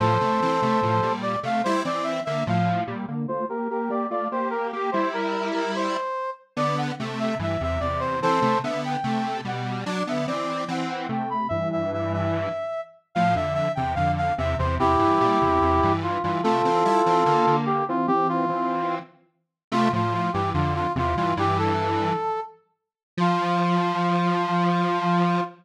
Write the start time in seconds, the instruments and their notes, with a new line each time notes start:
0.00 lead 1 (square) A2 F3, brass section A4 C5
0.21 lead 1 (square) C3 A3
0.42 lead 1 (square) E3 C4
0.62 lead 1 (square) C3 A3
0.83 lead 1 (square) A2 F3
1.02 lead 1 (square) A#2 G3
1.22 brass section D5
1.43 lead 1 (square) C3 A3, brass section F5
1.64 lead 1 (square) G3 E4, brass section C5
1.85 lead 1 (square) E3 C4, brass section D5
2.03 brass section E5
2.25 lead 1 (square) D3 A#3, brass section E5
2.47 lead 1 (square) A2 F3, brass section F5
2.87 lead 1 (square) A#2 G3
3.08 lead 1 (square) D3 A#3
3.28 lead 1 (square) A3 F4, brass section C5
3.49 lead 1 (square) A#3 G4, brass section A#4
3.70 lead 1 (square) A#3 G4, brass section A#4
3.90 lead 1 (square) A#3 G4, brass section D5
4.11 lead 1 (square) A3 F4, brass section D5
4.32 lead 1 (square) A#3 G4, brass section C5
4.50 brass section A#4
4.73 lead 1 (square) A#3 G4, brass section G4
4.92 lead 1 (square) G3 E4, brass section C5
5.13 brass section A#4
5.54 brass section A#4
5.75 brass section C5
6.57 lead 1 (square) D3 B3, brass section D5
6.78 brass section F#5
7.00 lead 1 (square) C3 A3
7.19 brass section E5
7.39 lead 1 (square) G2 E3, brass section E5
7.61 lead 1 (square) E2 C3, brass section E5
7.80 lead 1 (square) E2 C3, brass section D5
8.00 brass section C5
8.22 lead 1 (square) E3 C4, brass section A4 C5
8.42 lead 1 (square) C3 A3
8.64 lead 1 (square) D3 B3, brass section E5
8.85 brass section G5
9.04 lead 1 (square) C3 A3
9.45 lead 1 (square) B2 G3, brass section F#5
9.86 lead 1 (square) F#3 D4, brass section D5
10.07 lead 1 (square) D3 B3, brass section E5
10.27 lead 1 (square) E3 C4, brass section D5
10.68 lead 1 (square) E3 C4, brass section F#5
10.90 brass section F#5
11.09 lead 1 (square) C3 A3, brass section G5
11.30 brass section B5
11.49 lead 1 (square) G2 E3, brass section E5
11.72 brass section E5
11.93 brass section E5
12.13 brass section E5
13.15 lead 1 (square) A2 F3, brass section F5
13.35 lead 1 (square) F2 D3, brass section E5
13.54 brass section E5
13.75 lead 1 (square) E2 C3, brass section G5
13.95 lead 1 (square) F2 D3, brass section F5
14.17 brass section F5
14.38 lead 1 (square) E2 C3, brass section E5
14.58 lead 1 (square) E2 C3, brass section C5
14.79 lead 1 (square) E2 C3, brass section E4 G4
14.99 lead 1 (square) G2 E3
15.21 lead 1 (square) A#2 G3
15.41 lead 1 (square) E2 C3
15.62 lead 1 (square) E2 C3
15.83 lead 1 (square) G2 E3
16.03 brass section F4
16.23 lead 1 (square) G2 E3, brass section F4
16.43 lead 1 (square) C3 A3, brass section F4 A4
16.65 lead 1 (square) E3 C4
16.85 lead 1 (square) G3 E4
17.06 lead 1 (square) E3 C4
17.26 lead 1 (square) D3 A#3
17.47 lead 1 (square) D3 A#3
17.66 brass section G4
17.89 lead 1 (square) E3 C4, brass section F4
18.07 lead 1 (square) E3 C4, brass section G4
18.29 brass section F4
18.49 lead 1 (square) E3 C4
19.72 lead 1 (square) C3 A3, brass section F4
19.93 lead 1 (square) A2 F3, brass section F4
20.14 brass section F4
20.33 lead 1 (square) G2 E3, brass section G4
20.54 lead 1 (square) F2 D3, brass section F4
20.75 brass section F4
20.96 lead 1 (square) E2 C3, brass section F4
21.16 lead 1 (square) G2 E3, brass section F4
21.37 lead 1 (square) G2 E3, brass section G4
21.58 brass section A4
23.17 lead 1 (square) F3, brass section F4